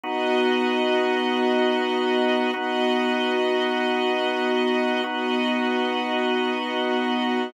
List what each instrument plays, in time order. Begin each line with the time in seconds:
0.03 drawbar organ B3 D#4 F#4, string ensemble 1 B3 F#4 D#5
2.53 string ensemble 1 B3 F#4 D#5, drawbar organ B3 D#4 F#4
5.03 string ensemble 1 B3 F#4 D#5, drawbar organ B3 D#4 F#4